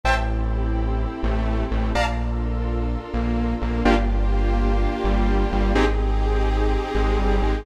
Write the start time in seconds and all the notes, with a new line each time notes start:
0.04 A1 C4 E4 G4 A4 C5 E5 G5 A5
1.23 A1 A3
1.71 A1 A3
1.95 A#1 D4 F4 A4 A#4 D5 F5 A5 A#5
3.13 A#1 A#3
3.62 A#1 A#3
3.84 G1 A#3 D4 F4 G4
5.04 G1 G3
5.52 G1 G3
5.75 G#1 C4 D#4 G4 G#4
6.95 G#1 G#3
7.18 G1 G3
7.43 G#1 G#3